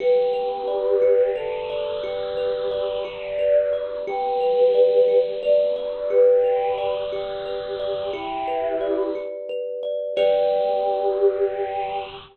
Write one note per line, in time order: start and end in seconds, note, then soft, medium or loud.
0.00 1.30 G4 medium
0.00 1.01 G4 medium
0.00 1.30 B4 medium
0.33 1.35 B4 medium
0.68 1.69 D5 medium
1.02 2.03 G4 medium
1.35 1.96 A4 medium
1.35 2.37 B4 medium
1.70 2.71 D5 medium
2.03 2.97 G4 medium
2.03 3.04 G4 medium
2.03 2.97 B4 medium
2.37 3.38 B4 medium
2.71 3.72 D5 medium
3.04 4.01 G4 medium
3.04 3.88 D5 medium
3.39 4.03 B4 medium
3.73 4.05 D5 medium
4.07 5.20 G4 medium
4.07 5.07 G4 medium
4.07 5.20 B4 loud
4.41 5.42 B4 medium
4.75 5.76 D5 medium
5.08 6.10 G4 medium
5.43 6.44 B4 medium
5.43 6.05 D5 medium
5.76 6.78 D5 medium
6.10 7.12 G4 medium
6.10 6.95 G4 medium
6.10 6.95 B4 loud
6.44 7.45 B4 medium
6.78 7.79 D5 medium
7.12 8.09 G4 medium
7.12 8.10 G4 medium
7.46 8.10 B4 medium
7.80 8.12 D5 medium
8.13 9.02 E4 medium
8.13 9.15 G4 medium
8.13 9.02 G4 medium
8.48 9.49 B4 medium
8.81 9.82 D5 medium
9.15 10.12 G4 medium
9.49 10.14 B4 medium
9.83 10.15 D5 medium
10.16 12.03 G4 loud
10.16 12.04 G4 loud
10.16 12.04 B4 loud
10.16 12.04 D5 loud